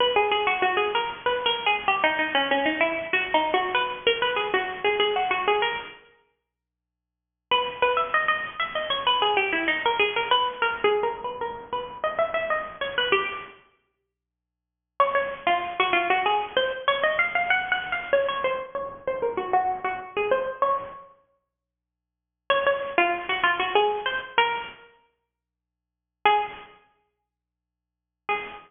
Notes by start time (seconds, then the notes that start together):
0.00 B4
0.16 G#4
0.31 G#4
0.47 F#4
0.62 F#4
0.77 G#4
0.95 A#4
1.26 B4
1.46 A#4
1.66 G#4
1.88 G4
2.03 D#4
2.19 D#4
2.35 C#4
2.51 C#4
2.65 D#4
2.81 E4
3.13 F#4
3.34 D#4
3.54 F#4
3.74 B4
4.07 A#4
4.22 B4
4.36 G#4
4.54 F#4
4.84 G#4
4.99 G#4
5.16 F#4
5.31 F#4
5.47 G#4
5.62 A#4
7.51 B4
7.82 B4
7.97 E5
8.14 D#5
8.28 D#5
8.60 E5
8.75 D#5
8.90 C#5
9.07 B4
9.22 G#4
9.37 G4
9.52 E4
9.68 D#4
9.85 A#4
9.99 G#4
10.16 A#4
10.31 B4
10.62 A#4
10.84 G#4
11.03 A#4
11.24 B4
11.41 A#4
11.73 B4
12.04 D#5
12.18 E5
12.34 E5
12.50 D#5
12.81 C#5
12.98 B4
13.12 G4
15.00 C#5
15.15 C#5
15.46 F4
15.80 F#4
15.93 F4
16.10 F#4
16.26 G#4
16.56 C5
16.88 C#5
17.03 D#5
17.19 F5
17.35 F5
17.50 F#5
17.72 F#5
17.92 F5
18.13 C#5
18.28 C#5
18.44 C5
18.75 C#5
19.07 C5
19.22 A#4
19.37 F#4
19.53 F#4
19.84 F#4
20.16 G#4
20.31 C5
20.62 C#5
22.50 C#5
22.66 C#5
22.98 F4
23.29 F#4
23.43 F4
23.59 F#4
23.75 G#4
24.06 C5
24.38 A#4
26.25 G#4
28.29 G#4